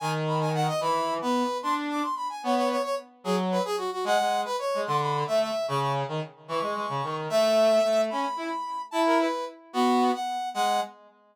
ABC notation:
X:1
M:6/8
L:1/8
Q:3/8=148
K:G#m
V:1 name="Brass Section"
g z b g f d | b3 B3 | =c' z =d' c' b g | c c c c z2 |
G z B G F F | f3 B c2 | =c' b2 e e2 | c' c' z4 |
[K:C#m] c'6 | e6 | b6 | a ^A B2 z2 |
[K:G#m] F3 f3 | f2 z4 |]
V:2 name="Brass Section"
D,6 | E,3 B,2 z | =D3 z3 | B,3 z3 |
F,3 z3 | G, G,2 z2 G, | =D,3 =A,2 z | C,3 D, z2 |
[K:C#m] E, G, G, C, D,2 | A,4 A,2 | C z E z3 | E3 z3 |
[K:G#m] B,3 z3 | G,2 z4 |]